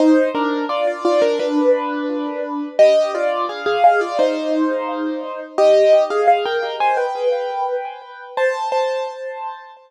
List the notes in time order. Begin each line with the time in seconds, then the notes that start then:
0.00 D#4 C5
0.35 D4 A#4
0.69 F4 D5
0.87 F4 D5
1.05 F4 D5
1.22 D4 A#4
1.39 D4 B4
2.79 G4 D#5
3.15 F4 D5
3.49 G#4 F5
3.66 G#4 F5
3.84 G#4 F5
4.01 F4 D5
4.19 D#4 C5
5.58 G4 D#5
6.10 G#4 F5
6.28 G#4 F5
6.45 A#4 G5
6.80 C5 G#5
6.97 B4 G5
8.37 C5 A5
8.72 C5 A5